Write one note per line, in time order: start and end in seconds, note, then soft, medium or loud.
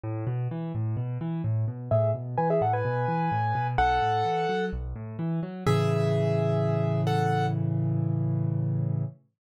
0.04 0.25 A2 loud
0.27 0.48 B2 medium
0.51 0.72 E3 medium
0.75 0.96 A2 medium
0.97 1.18 B2 medium
1.21 1.42 E3 medium
1.44 1.65 A2 medium
1.68 1.89 B2 medium
1.91 2.12 A2 loud
1.91 2.11 G#4 loud
1.91 2.11 E5 loud
2.15 2.36 B2 medium
2.38 2.59 E3 medium
2.38 2.49 B4 medium
2.38 2.49 G#5 loud
2.50 2.61 G#4 medium
2.50 2.61 E5 loud
2.61 2.82 A2 medium
2.61 2.73 A4 medium
2.61 2.73 F#5 medium
2.73 3.67 B4 medium
2.73 3.67 G#5 medium
2.85 3.06 B2 medium
3.08 3.29 E3 medium
3.32 3.53 A2 medium
3.55 3.76 B2 medium
3.78 3.99 B1 loud
3.78 4.65 A4 medium
3.78 4.65 F#5 loud
4.02 4.23 A2 medium
4.25 4.46 E3 medium
4.49 4.70 F#3 medium
4.73 4.94 B1 medium
4.96 5.17 A2 medium
5.19 5.40 E3 medium
5.43 5.64 F#3 medium
5.66 9.04 A2 medium
5.66 9.04 C#3 medium
5.66 9.04 E3 medium
5.66 7.01 G#4 medium
5.66 7.01 E5 loud
7.07 7.46 A4 medium
7.07 7.46 F#5 medium